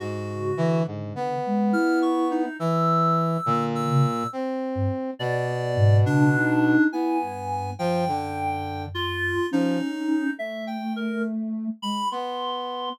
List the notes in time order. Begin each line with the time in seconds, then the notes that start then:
0.00 G#2 F#4
0.29 C#3
0.57 D3 E3
0.87 G#2
1.16 B3
1.46 G#3
1.72 E4 F6
2.02 C#6
2.31 D#4
2.59 E3 E6
3.46 A#2 D3
3.75 E6
3.90 C#3
4.33 C4
4.75 G2
5.19 B2 D5
5.48 B3
5.77 G#2
6.06 C#3 D4
6.34 D#4
6.92 B3 E4 G#5
7.21 G2
7.79 F#2 F3 G5
8.08 D3
8.94 F4
9.51 F3 C#4 D#4
10.37 A3 E5
10.67 G5
10.96 A#4
11.82 G#3 B5
12.11 B3 C6